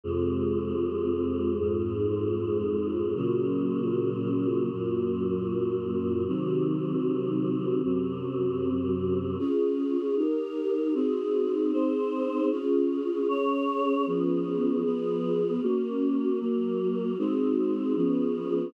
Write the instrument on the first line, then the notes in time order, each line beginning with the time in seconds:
choir aahs
0.04 F2 C3 G#3
1.60 F2 G#2 G#3
3.15 A#2 C#3 F#3
4.71 F#2 A#2 F#3
6.27 C3 D#3 F#3
7.83 F#2 C3 F#3
9.39 C#4 F4 G#4
10.17 D#4 G4 A#4
10.94 C4 D#4 F#4 G#4
11.72 C4 D#4 G#4 C5
12.50 C#4 F4 G#4
13.28 C#4 G#4 C#5
14.06 F3 B3 C#4 G#4
14.84 F3 B3 F4 G#4
15.62 A#3 C#4 F#4
16.40 F#3 A#3 F#4
17.18 G#3 C4 D#4 F#4
17.96 F3 B3 C#4 G#4